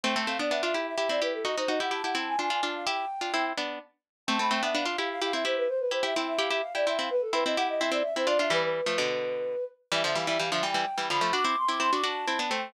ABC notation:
X:1
M:6/8
L:1/16
Q:3/8=85
K:Am
V:1 name="Flute"
g a f d e e e e e d B A | ^d c d ^f a f a ^g g g a =f | g6 z6 | a b g e f f f f f e c B |
c B c e g e f e f d e f | B A B ^d ^f d e =d e c d e | B B9 z2 | [K:C] e e f e f e g4 b2 |
d' d' c' d' c' d' a4 g2 |]
V:2 name="Harpsichord"
[A,C] [A,C] [A,C] [B,D] [B,D] [DF] [EG]2 [EG] [CE] [EG]2 | [^D^F] [DF] [DF] [EG] [EG] [EG] [CE]2 [=D=F] [DF] [DF]2 | [EG]2 z [DF] [CE]2 [B,D]2 z4 | [A,C] [A,C] [A,C] [B,D] [B,D] [DF] [EG]2 [EG] [CE] [EG]2 |
z2 [EG] [EG] [CE]2 [EG] [EG] z [EG] [CE] [CE] | z2 [CE] [CE] [EG]2 [CE] [CE] z [CE] [DF] [DF] | [E,G,]3 [F,A,] [B,,D,]6 z2 | [K:C] [E,G,] [D,F,] [E,G,] [E,G,] [E,G,] [D,F,] [E,G,] [E,G,] z [E,G,] [D,F,] [F,A,] |
[D^F] [CE] z [CE] [CE] [DF] [DF]2 [CE] [B,D] [A,C]2 |]